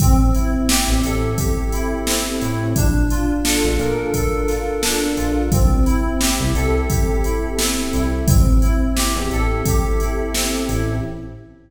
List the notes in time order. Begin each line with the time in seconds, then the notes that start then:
0.00 A1 C4, kick, closed hi-hat
0.34 E4, closed hi-hat
0.69 G4, snare
0.88 A1
1.03 A1 A4, closed hi-hat
1.38 G4, kick, closed hi-hat
1.72 E4, closed hi-hat
2.07 C4, snare
2.41 A2 E4, closed hi-hat
2.76 A#1 D4, kick, closed hi-hat
3.10 F4, closed hi-hat
3.44 A4, snare
3.64 A#1
3.79 A#2 A#4, closed hi-hat
4.14 A4, kick, closed hi-hat
4.48 F4, snare, closed hi-hat
4.83 D4, snare
5.17 A#1 F4, closed hi-hat
5.52 C2 C4, kick, closed hi-hat
5.86 E4, closed hi-hat
6.20 G4, snare
6.40 C2
6.54 C2 A4, closed hi-hat
6.89 G4, kick, closed hi-hat
7.24 E4, closed hi-hat
7.59 C4, snare
7.93 C2 E4, closed hi-hat
8.27 A1 C4, kick, closed hi-hat
8.62 E4, closed hi-hat
8.96 G4, snare
9.16 E2
9.31 A1 A4, closed hi-hat
9.66 G4, kick, closed hi-hat
10.00 E4, closed hi-hat
10.34 C4, snare
10.69 A1 E4, closed hi-hat